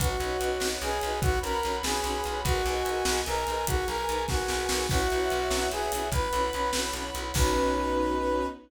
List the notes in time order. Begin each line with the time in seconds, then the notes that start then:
0.00 B1 C#4 D#4 F#4 B4 C#5 D#5 F#5, kick, closed hi-hat
0.20 B1 C#4 D#4 F#4 B4, closed hi-hat
0.41 B1 C#4 D#4 F#4 B4, closed hi-hat
0.60 B1 C#4 D#4 F#4 B4, snare
0.82 B1 C#4 D#4 F#4 G#4 B4, closed hi-hat
1.01 B1 C#4 D#4 F#4 B4, closed hi-hat
1.22 B1 C#4 D#4 F#4 B4 C#5 F#5 B5, kick, closed hi-hat
1.43 B1 C#4 D#4 F#4 A#4 B4, closed hi-hat
1.63 B1 C#4 D#4 F#4 B4, closed hi-hat
1.83 B1 C#4 D#4 F#4 G#4 B4, snare
2.04 B1 C#4 D#4 F#4 B4, closed hi-hat
2.24 B1 C#4 D#4 F#4 B4, closed hi-hat
2.44 B1 D#4 F#4 G#4 A#4 B4 D#5 G#5, kick, closed hi-hat
2.66 B1 D#4 G#4 A#4 B4, closed hi-hat
2.85 B1 D#4 G#4 A#4 B4, closed hi-hat
3.05 B1 D#4 G#4 A#4 B4, snare
3.26 B1 D#4 G#4 A#4 B4, closed hi-hat
3.47 B1 D#4 G#4 A#4 B4, closed hi-hat
3.66 B1 D#4 F#4 G#4 A#4 B4 G#5, kick, closed hi-hat
3.88 B1 D#4 G#4 A#4 B4, closed hi-hat
4.09 B1 D#4 G#4 A#4 B4, closed hi-hat
4.28 B1 D#4 F#4 G#4 A#4 B4, kick, snare, closed hi-hat
4.48 B1 D#4 G#4 A#4 B4, snare
4.69 B1 D#4 G#4 A#4 B4, snare
4.89 B1 C#4 E4 F#4 B4 C#5 E5 F#5, kick, crash
5.10 B1 C#4 E4 F#4 B4, closed hi-hat
5.30 B1 C#4 E4 F#4 B4, closed hi-hat
5.50 B1 C#4 E4 F#4 B4, snare
5.72 B1 C#4 E4 F#4 G#4 B4, closed hi-hat
5.92 B1 C#4 E4 F#4 B4, open hi-hat
6.12 B1 C#4 E4 F#4 B4 C#5 F#5 B5, kick, closed hi-hat
6.33 B1 C#4 E4 F#4 B4, closed hi-hat
6.53 B1 C#4 E4 F#4 B4, closed hi-hat
6.73 B1 C#4 E4 F#4 B4, snare
6.93 B1 C#4 E4 F#4 B4, closed hi-hat
7.15 B1 C#4 E4 F#4 B4, closed hi-hat
7.34 B1 B3 C#4 D#4 F#4 B4, kick, crash